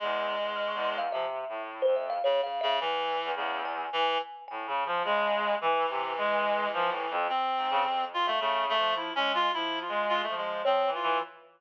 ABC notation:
X:1
M:5/4
L:1/16
Q:1/4=107
K:none
V:1 name="Clarinet"
^G,8 F, z7 (3^C,2 C,2 C,2 | E,4 ^C,2 z2 E,2 z6 C,4 | E,12 C6 F A, | A,2 A,2 (3E2 ^C2 F2 E2 F2 F A, ^G,2 =C2 F2 |]
V:2 name="Kalimba"
z4 f' ^c' =c' f e4 z c e f (3^c2 f2 e2 | z6 ^g6 g4 z a z2 | z19 f | z16 ^c2 z2 |]
V:3 name="Clarinet" clef=bass
(3E,,4 E,,4 E,,4 (3C,4 A,,4 F,,4 z4 | E,,3 E,, E,,4 z4 (3A,,2 ^C,2 F,2 ^G,4 | E,2 C,2 ^G,4 (3F,2 A,,2 F,,2 z2 ^G,, ^C, F,,4 | (3^C,4 F,4 ^G,4 (3F,4 G,4 F,4 (3F,2 E,2 E,2 |]